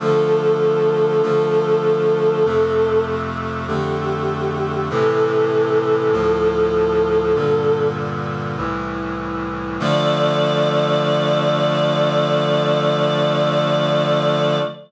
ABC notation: X:1
M:4/4
L:1/8
Q:1/4=49
K:Dm
V:1 name="Choir Aahs"
A6 G2 | A5 z3 | d8 |]
V:2 name="Brass Section"
[D,F,A,]2 [D,F,A,]2 [F,,C,A,]2 [F,,D,A,]2 | [A,,C,E,]2 [D,,A,,F,]2 [G,,B,,D,]2 [C,,A,,E,]2 | [D,F,A,]8 |]